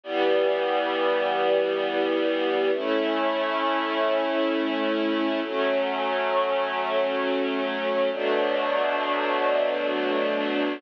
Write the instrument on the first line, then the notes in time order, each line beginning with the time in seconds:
string ensemble 1
0.04 E3 G3 B3
2.73 A3 C#4 E4
5.43 F#3 A3 C#4
8.13 B2 F#3 A3 D4